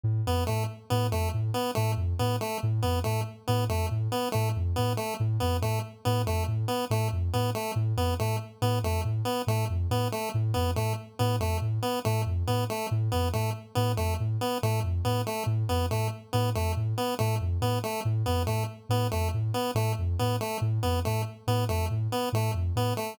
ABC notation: X:1
M:2/4
L:1/8
Q:1/4=140
K:none
V:1 name="Ocarina" clef=bass
A,, F,, A,, z | A,, F,, A,, z | A,, F,, A,, z | A,, F,, A,, z |
A,, F,, A,, z | A,, F,, A,, z | A,, F,, A,, z | A,, F,, A,, z |
A,, F,, A,, z | A,, F,, A,, z | A,, F,, A,, z | A,, F,, A,, z |
A,, F,, A,, z | A,, F,, A,, z | A,, F,, A,, z | A,, F,, A,, z |
A,, F,, A,, z | A,, F,, A,, z | A,, F,, A,, z | A,, F,, A,, z |
A,, F,, A,, z | A,, F,, A,, z | A,, F,, A,, z | A,, F,, A,, z |
A,, F,, A,, z | A,, F,, A,, z | A,, F,, A,, z |]
V:2 name="Lead 1 (square)"
z B, A, z | B, A, z B, | A, z B, A, | z B, A, z |
B, A, z B, | A, z B, A, | z B, A, z | B, A, z B, |
A, z B, A, | z B, A, z | B, A, z B, | A, z B, A, |
z B, A, z | B, A, z B, | A, z B, A, | z B, A, z |
B, A, z B, | A, z B, A, | z B, A, z | B, A, z B, |
A, z B, A, | z B, A, z | B, A, z B, | A, z B, A, |
z B, A, z | B, A, z B, | A, z B, A, |]